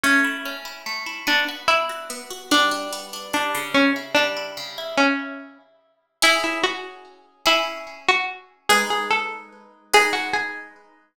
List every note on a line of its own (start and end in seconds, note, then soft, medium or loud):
0.03 0.86 A3 medium
0.03 0.55 C#4 medium
0.24 0.65 E4 medium
0.45 1.24 C#4 medium
0.65 1.06 E4 medium
0.86 1.25 A3 medium
1.06 1.26 E4 medium
1.27 2.09 B3 medium
1.27 1.45 D4 medium
1.48 1.89 F#4 medium
1.68 2.46 D4 medium
1.68 2.49 E4 medium
1.89 2.30 F#4 medium
2.10 2.49 B3 medium
2.30 2.50 F#4 medium
2.51 3.33 G3 medium
2.51 3.31 D4 medium
2.71 3.13 D4 medium
2.93 3.71 B3 medium
3.13 3.72 D4 medium
3.33 3.73 G3 medium
3.33 3.74 D4 medium
3.54 4.57 C#3 medium
3.74 3.93 C#4 medium
3.96 4.36 E4 medium
4.15 4.94 G3 medium
4.15 4.82 D4 medium
4.37 4.77 E4 medium
4.57 4.96 C#3 medium
4.78 4.97 E4 medium
4.97 5.58 C#4 medium
6.22 7.34 C#4 loud
6.22 7.34 E4 medium
6.22 6.42 E4 medium
6.22 7.34 G#4 loud
6.44 6.62 E4 medium
6.63 7.42 F#4 medium
7.46 8.57 C#4 medium
7.46 8.57 E4 medium
7.46 7.98 E4 medium
7.46 8.57 G#4 medium
8.09 8.27 F#4 medium
8.69 9.81 G#3 loud
8.69 9.81 D#4 loud
8.69 8.87 G#4 medium
8.69 9.81 B4 loud
8.90 9.10 G#4 medium
9.10 9.79 A4 medium
9.93 11.05 G#3 medium
9.93 11.05 D#4 loud
9.93 10.14 G#4 medium
9.93 11.05 B4 medium
10.13 10.32 F#4 medium
10.33 11.13 G#4 medium